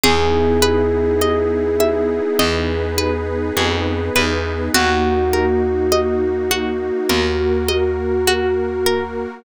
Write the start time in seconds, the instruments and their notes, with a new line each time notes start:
0.04 electric bass (finger) E2, pad 2 (warm) B3 D#4 E4 G#4, pizzicato strings G#4, electric piano 1 G#4, low conga
0.62 pizzicato strings B4, high conga
1.21 pizzicato strings D#5, high conga
1.80 pizzicato strings E5, high conga
2.39 electric bass (finger) E2, pad 2 (warm) B3 D#4 G#4 B4, pizzicato strings D#5, low conga
2.98 pizzicato strings B4, high conga
3.57 electric bass (finger) F2, pizzicato strings G#4, high conga
4.16 electric bass (finger) E2, pizzicato strings B4, high conga
4.75 electric bass (finger) D#2, pad 2 (warm) A#3 D#4 F#4, pizzicato strings F#4, electric piano 1 F#4, low conga
5.33 pizzicato strings A#4, high conga
5.92 pizzicato strings D#5, high conga
6.51 pizzicato strings F#4, high conga
7.10 electric bass (finger) D#2, pad 2 (warm) A#3 F#4 A#4, pizzicato strings A#4, low conga
7.69 pizzicato strings D#5, high conga
8.27 pizzicato strings F#4, high conga
8.86 pizzicato strings A#4